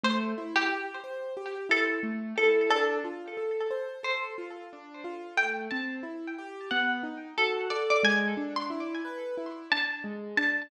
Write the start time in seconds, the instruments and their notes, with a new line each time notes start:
0.03 acoustic grand piano A3, pizzicato strings C5
0.38 acoustic grand piano E4
0.56 pizzicato strings G4
0.69 acoustic grand piano G4
1.04 acoustic grand piano C5
1.37 acoustic grand piano G4
1.69 acoustic grand piano E4, pizzicato strings A4
2.03 acoustic grand piano A3
2.38 acoustic grand piano E4, pizzicato strings A4
2.70 acoustic grand piano D4, pizzicato strings A4
3.04 acoustic grand piano F4
3.37 acoustic grand piano A4
3.71 acoustic grand piano C5
4.03 acoustic grand piano A4, pizzicato strings C5
4.38 acoustic grand piano F4
4.73 acoustic grand piano D4
5.04 acoustic grand piano F4
5.37 acoustic grand piano A3, pizzicato strings G5
5.71 acoustic grand piano C4, pizzicato strings A5
6.03 acoustic grand piano E4
6.38 acoustic grand piano G4
6.71 acoustic grand piano B3, pizzicato strings F#5
7.03 acoustic grand piano D#4
7.38 acoustic grand piano F#4, pizzicato strings A4
7.70 acoustic grand piano A4, pizzicato strings D5
7.90 pizzicato strings D5
8.03 acoustic grand piano G#3, pizzicato strings G#5
8.37 acoustic grand piano D4
8.56 pizzicato strings C6
8.70 acoustic grand piano E4
9.05 acoustic grand piano B4
9.38 acoustic grand piano E4
9.72 acoustic grand piano D4, pizzicato strings A5
10.04 acoustic grand piano G#3
10.37 acoustic grand piano D4, pizzicato strings A5